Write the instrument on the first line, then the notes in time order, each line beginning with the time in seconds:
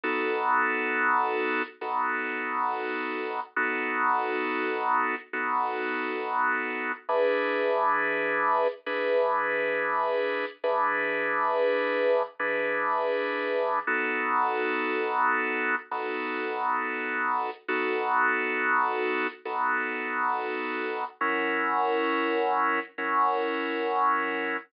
drawbar organ
0.04 B3 D#4 F#4 A4
1.81 B3 D#4 F#4 A4
3.56 B3 D#4 F#4 A4
5.33 B3 D#4 F#4 A4
7.09 E3 D4 G#4 B4
8.86 E3 D4 G#4 B4
10.64 E3 D4 G#4 B4
12.39 E3 D4 G#4 B4
13.87 B3 D#4 F#4 A4
15.91 B3 D#4 F#4 A4
17.68 B3 D#4 F#4 A4
19.45 B3 D#4 F#4 A4
21.21 F#3 C#4 E4 A#4
22.98 F#3 C#4 E4 A#4